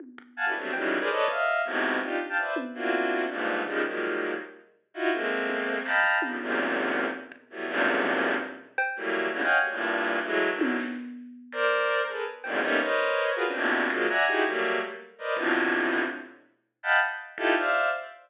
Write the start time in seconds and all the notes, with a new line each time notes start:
0.00 high tom
0.18 kick
0.37 F5 F#5 G#5 A5
0.46 D4 E4 F#4 G4 A4 B4
0.55 F#3 G3 A3 B3 C4 D4
0.73 C#3 D#3 E3 F#3 G3 G#3, cowbell
1.00 G#4 A#4 B4 C5 D5
1.10 A4 B4 C#5 D5 D#5
1.28 D#5 E5 F5, kick
1.65 G#2 A2 B2 C3
2.01 D4 D#4 F4 G4
2.20 kick
2.29 F5 G5 A5
2.38 B4 C5 D5 E5
2.56 high tom
2.74 A#3 C4 D4 E4 F4 F#4
3.29 G2 G#2 A#2
3.66 C#3 D#3 F3 G3 G#3, floor tom
3.84 D#3 F3 F#3 G3 G#3 A#3
4.94 D#4 E4 F4 F#4
5.12 G#3 A3 A#3 C4
5.49 high tom
5.67 kick
5.85 D#5 F5 G5 A5 A#5 B5, clap
6.04 floor tom
6.22 C#3 D3 D#3 F3 G3, high tom
6.40 E2 F#2 G#2 A#2 C3
7.13 floor tom
7.32 kick
7.50 E3 F#3 G3 A3 B3
7.68 E2 F#2 G2 G#2 A#2 C3
8.05 floor tom
8.23 floor tom
8.78 cowbell
8.96 E3 F#3 G3 A3 A#3
9.33 G#2 A#2 B2 C#3 D3 E3
9.42 C#5 D#5 F5 F#5 G5 G#5
9.51 floor tom
9.60 F#3 G3 A3 A#3
9.70 G2 A2 A#2
10.25 E3 F#3 G#3 A3
10.52 D3 D#3 E3 F#3
10.61 high tom
10.79 snare
11.52 A#4 C5 D5, closed hi-hat
12.07 G#4 A4 A#4 B4
12.44 E2 F2 F#2 G#2 A#2, cowbell
12.62 G3 A3 A#3 B3 C#4 D#4, floor tom
12.80 A#4 B4 C5 C#5 D#5
13.35 F4 F#4 G#4 A#4 B4
13.45 C4 C#4 D4
13.54 A2 A#2 B2 C3 D3, cowbell
13.90 F3 F#3 G#3 A#3, closed hi-hat
14.09 D5 E5 F#5 G#5 A#5
14.27 D#4 E4 F#4 G4 G#4
14.45 F#3 G3 A3 A#3
15.18 A#4 B4 C5 D5 D#5
15.36 A2 B2 C3 D3 E3 F3, kick
15.55 floor tom
16.83 D#5 F5 F#5 G5 A5 B5
17.01 kick
17.38 D#4 E4 F4 G4 A4, kick
17.56 C5 D5 E5 F5